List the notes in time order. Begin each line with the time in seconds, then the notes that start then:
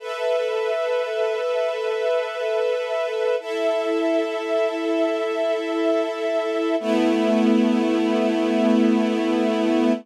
0.00 A4 B4 E5
3.40 E4 A4 E5
6.80 A3 B3 E4